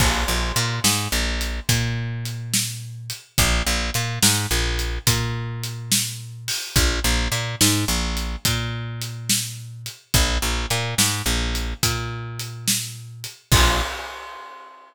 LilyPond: <<
  \new Staff \with { instrumentName = "Electric Bass (finger)" } { \clef bass \time 12/8 \key bes \major \tempo 4. = 71 bes,,8 bes,,8 bes,8 aes,8 bes,,4 bes,2. | bes,,8 bes,,8 bes,8 aes,8 bes,,4 bes,2. | bes,,8 bes,,8 bes,8 aes,8 bes,,4 bes,2. | bes,,8 bes,,8 bes,8 aes,8 bes,,4 bes,2. |
bes,,4. r1 r8 | }
  \new DrumStaff \with { instrumentName = "Drums" } \drummode { \time 12/8 <cymc bd>4 hh8 sn4 hh8 <hh bd>4 hh8 sn4 hh8 | <hh bd>4 hh8 sn4 hh8 <hh bd>4 hh8 sn4 hho8 | <hh bd>4 hh8 sn4 hh8 <hh bd>4 hh8 sn4 hh8 | <hh bd>4 hh8 sn4 hh8 <hh bd>4 hh8 sn4 hh8 |
<cymc bd>4. r4. r4. r4. | }
>>